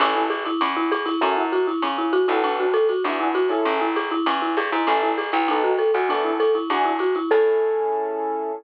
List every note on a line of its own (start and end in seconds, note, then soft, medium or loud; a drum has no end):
0.00 0.49 A1 loud
0.00 0.14 C#4 medium
0.00 0.22 C#4 loud
0.00 0.22 E4 loud
0.00 0.22 G#4 loud
0.00 0.22 A4 loud
0.00 ride loud
0.15 0.29 E4 medium
0.30 0.44 G#4 medium
0.30 hi-hat pedal loud
0.30 ride loud
0.45 0.60 E4 medium
0.45 ride medium
0.61 1.10 E2 loud
0.61 0.76 C#4 medium
0.61 ride loud
0.76 0.90 E4 medium
0.91 1.06 G#4 medium
0.91 hi-hat pedal loud
0.91 ride loud
1.06 1.20 E4 medium
1.06 ride loud
1.21 1.70 F#2 loud
1.21 1.42 C#4 loud
1.21 1.36 C#4 medium
1.21 1.42 E4 loud
1.21 1.42 F#4 loud
1.21 1.42 A4 loud
1.21 kick medium
1.21 ride loud
1.37 1.51 E4 medium
1.52 1.66 F#4 medium
1.52 hi-hat pedal loud
1.52 ride medium
1.67 1.81 E4 medium
1.67 ride medium
1.82 2.26 C#3 loud
1.82 1.97 C#4 medium
1.82 kick medium
1.82 ride loud
1.98 2.12 E4 medium
2.13 2.27 F#4 medium
2.13 kick medium
2.13 hi-hat pedal loud
2.13 ride loud
2.28 2.92 B1 loud
2.28 2.66 B3 loud
2.28 2.66 D4 loud
2.28 2.42 E4 medium
2.28 2.66 F#4 loud
2.28 2.66 A4 loud
2.28 ride medium
2.44 2.58 D4 medium
2.44 ride loud
2.60 2.74 F#4 medium
2.74 2.88 A4 medium
2.74 hi-hat pedal loud
2.74 ride loud
2.89 3.03 F#4 medium
2.89 ride medium
3.04 3.53 E2 loud
3.04 3.19 D4 medium
3.04 3.28 D4 loud
3.04 3.28 E4 loud
3.04 3.28 F#4 loud
3.04 3.28 G#4 loud
3.04 ride loud
3.20 3.34 E4 medium
3.34 3.49 F#4 medium
3.34 hi-hat pedal loud
3.34 ride loud
3.49 3.86 C#4 loud
3.49 3.86 E4 loud
3.49 3.64 E4 medium
3.49 3.86 G#4 loud
3.49 3.86 A4 loud
3.49 ride medium
3.65 4.14 A1 loud
3.65 3.80 C#4 medium
3.65 kick medium
3.65 ride loud
3.81 3.95 E4 medium
3.95 4.10 G#4 medium
3.95 hi-hat pedal medium
3.95 ride loud
4.11 4.25 E4 medium
4.11 ride medium
4.26 4.56 E2 loud
4.26 4.41 C#4 medium
4.26 ride loud
4.42 4.56 E4 medium
4.56 4.70 G2 medium
4.56 4.71 G#4 medium
4.56 hi-hat pedal loud
4.56 ride loud
4.72 4.86 G#2 loud
4.72 4.86 E4 medium
4.72 ride medium
4.87 5.31 A1 loud
4.87 5.01 C#4 medium
4.87 5.09 C#4 loud
4.87 5.09 E4 loud
4.87 5.09 G#4 loud
4.87 5.09 A4 loud
4.87 ride loud
5.03 5.17 E4 medium
5.18 5.32 G#4 medium
5.18 hi-hat pedal loud
5.18 ride loud
5.32 5.91 B1 loud
5.32 5.47 E4 medium
5.32 ride medium
5.48 5.72 B3 loud
5.48 5.62 D#4 medium
5.48 5.72 D#4 loud
5.48 5.72 F#4 loud
5.48 5.72 A4 loud
5.48 ride loud
5.64 5.78 F#4 medium
5.78 5.93 A4 medium
5.78 kick medium
5.78 hi-hat pedal loud
5.78 ride medium
5.94 6.58 E2 loud
5.94 6.09 F#4 medium
5.94 ride medium
6.09 6.32 B3 loud
6.09 6.23 D4 medium
6.09 6.32 D4 loud
6.09 6.32 E4 loud
6.09 6.32 A4 loud
6.09 kick medium
6.09 ride loud
6.24 6.39 E4 medium
6.40 6.54 A4 medium
6.40 kick medium
6.40 hi-hat pedal loud
6.40 ride loud
6.55 6.69 E4 medium
6.55 ride medium
6.69 7.19 E2 loud
6.69 6.84 D4 medium
6.69 6.92 D4 loud
6.69 6.92 E4 loud
6.69 6.92 F#4 loud
6.69 6.92 G#4 loud
6.69 kick medium
6.69 ride loud
6.85 6.99 E4 medium
6.99 7.14 F#4 medium
6.99 hi-hat pedal loud
6.99 ride loud
7.15 7.30 E4 medium
7.15 ride medium
7.30 8.52 A2 loud
7.30 8.52 C#4 loud
7.30 8.52 E4 loud
7.30 8.52 G#4 loud
7.30 8.52 A4 loud
7.30 kick loud
7.30 crash loud